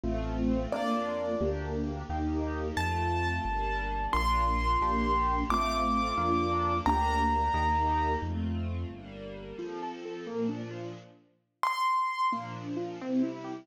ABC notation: X:1
M:6/8
L:1/8
Q:3/8=88
K:Bb
V:1 name="Acoustic Grand Piano"
z3 d3 | z6 | a6 | c'6 |
d'6 | b6 | z6 | [K:F] z6 |
z3 c'3 | z6 |]
V:2 name="Acoustic Grand Piano"
[A,CF]3 [B,DF]3 | [B,DG]3 [B,EG]3 | z6 | [B,DF]3 [B,DG]3 |
[A,CF]3 [B,DF]3 | [B,DG]3 [B,EG]3 | z6 | [K:F] F, A A B, D F |
z6 | B, D F C E G |]
V:3 name="Acoustic Grand Piano" clef=bass
A,,,3 F,,3 | D,,3 E,,3 | F,,3 G,,,3 | B,,,3 B,,,3 |
A,,,3 F,,3 | D,,3 E,,3 | F,,3 G,,,3 | [K:F] z6 |
z6 | z6 |]
V:4 name="String Ensemble 1"
[A,CF]3 [B,DF]3 | [B,DG]3 [B,EG]3 | [A,CF]3 [G,B,D]3 | [B,DF]3 [B,DG]3 |
[A,CF]3 [B,DF]3 | [B,DG]3 [B,EG]3 | [A,CF]3 [G,B,D]3 | [K:F] [F,CA]3 [B,,F,D]3 |
z6 | [B,,F,D]3 [C,G,E]3 |]